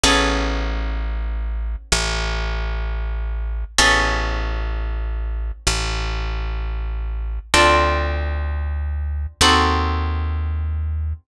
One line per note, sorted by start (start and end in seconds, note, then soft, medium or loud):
0.04 1.76 A1 loud
0.04 3.71 B3 medium
0.04 3.71 C#4 loud
0.04 3.71 G#4 loud
0.04 3.71 A4 loud
1.92 3.65 A1 loud
3.79 5.52 A1 loud
3.79 7.46 B3 medium
3.79 7.46 C#4 loud
3.79 7.46 G#4 loud
3.79 7.46 A4 loud
5.67 7.39 A1 medium
7.54 9.27 D2 loud
7.54 9.38 C4 loud
7.54 9.38 D4 medium
7.54 9.38 F4 medium
7.54 9.38 A4 medium
9.41 11.13 D#2 medium
9.41 11.26 C4 medium
9.41 11.26 D#4 medium
9.41 11.26 F#4 loud
9.41 11.26 A4 loud